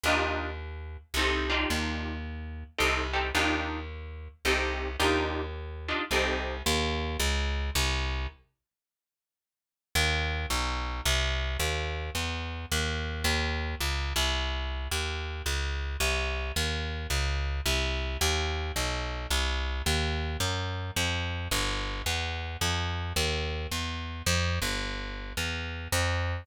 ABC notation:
X:1
M:3/4
L:1/8
Q:"Swing" 1/4=109
K:Eb
V:1 name="Acoustic Guitar (steel)"
[DEFG]4 [CEG=A] [DEFG]- | [DEFG]4 [CEG=A] [CEGA] | [DEFG]4 [CEG=A]2 | [DEFG]3 [DEFG] [CEG=A]2 |
z6 | z6 | z6 | z6 |
z6 | z6 | z6 | z6 |
z6 | z6 | z6 | z6 |]
V:2 name="Electric Bass (finger)" clef=bass
E,,4 C,,2 | E,,4 C,,2 | E,,4 C,,2 | E,,4 C,,2 |
E,,2 _D,,2 C,,2 | z6 | E,,2 =B,,,2 C,,2 | E,,2 =E,,2 _E,,2 |
E,,2 _D,, C,,3 | E,,2 _D,,2 C,,2 | E,,2 _D,,2 C,,2 | E,,2 =B,,,2 C,,2 |
E,,2 _G,,2 F,,2 | G,,,2 =E,,2 F,,2 | E,,2 =E,,2 F,, G,,,- | G,,,2 =E,,2 F,,2 |]